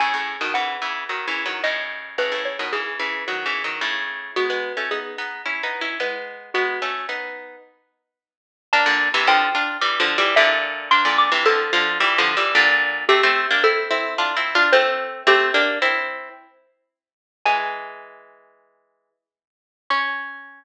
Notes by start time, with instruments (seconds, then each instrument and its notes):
0.00 pizzicato strings A2 C#3, xylophone G#5
0.14 pizzicato strings A2 C#3
0.41 pizzicato strings B2 D#3
0.54 pizzicato strings C#3 E3, xylophone F#5
0.82 pizzicato strings C#3 E3
1.09 pizzicato strings D#3 F#3
1.28 pizzicato strings C#3 E3
1.46 pizzicato strings D#3 F#3
1.64 pizzicato strings A2 C#3, xylophone D#5
2.18 pizzicato strings A2 C#3, xylophone B4
2.32 pizzicato strings A2 C#3
2.45 xylophone C#5
2.59 pizzicato strings B2 D#3
2.73 pizzicato strings C#3 E3, xylophone G#4
2.99 pizzicato strings C#3 E3
3.28 pizzicato strings D#3 F#3
3.46 pizzicato strings C#3 E3
3.64 pizzicato strings D#3 F#3
3.81 pizzicato strings A2 C#3
4.36 pizzicato strings G#3 B3, xylophone F#4
4.50 pizzicato strings G#3 B3
4.77 pizzicato strings A3 C#4
4.91 pizzicato strings B3 D#4, xylophone G#4
5.18 pizzicato strings B3 D#4
5.46 pizzicato strings C#4 E4
5.63 pizzicato strings B3 D#4
5.81 pizzicato strings C#4 E4
6.00 pizzicato strings G#3 B3, xylophone B4
6.54 pizzicato strings G#3 B3, xylophone F#4
6.82 pizzicato strings A3 C#4
7.09 pizzicato strings B3 D#4
8.73 pizzicato strings A#3 D4, xylophone A5
8.86 pizzicato strings A#2 D3
9.14 pizzicato strings C3 E3
9.27 pizzicato strings D3 F3, xylophone G5
9.55 pizzicato strings D4 F4
9.81 pizzicato strings E3 G3
10.00 pizzicato strings D3 F3
10.18 pizzicato strings E3 G3
10.36 pizzicato strings A#2 D3, xylophone E5
10.91 pizzicato strings A#3 D4, xylophone C6
11.05 pizzicato strings A#2 D3
11.18 xylophone D6
11.32 pizzicato strings C3 E3
11.45 pizzicato strings D3 F3, xylophone A4
11.73 pizzicato strings D3 F3
12.00 pizzicato strings E3 G3
12.18 pizzicato strings D3 F3
12.37 pizzicato strings E3 G3
12.55 pizzicato strings A#2 D3
13.09 pizzicato strings A3 C4, xylophone G4
13.23 pizzicato strings A3 C4
13.51 pizzicato strings A#3 D4
13.64 pizzicato strings C4 E4, xylophone A4
13.91 pizzicato strings C4 E4
14.18 pizzicato strings D4 F4
14.36 pizzicato strings C4 E4
14.55 pizzicato strings D4 F4
14.73 pizzicato strings A3 C4, xylophone C5
15.27 pizzicato strings A3 C4, xylophone G4
15.54 pizzicato strings A#3 D4
15.82 pizzicato strings C4 E4
17.45 pizzicato strings E3 G#3, xylophone G#5
19.90 pizzicato strings C#4, xylophone C#6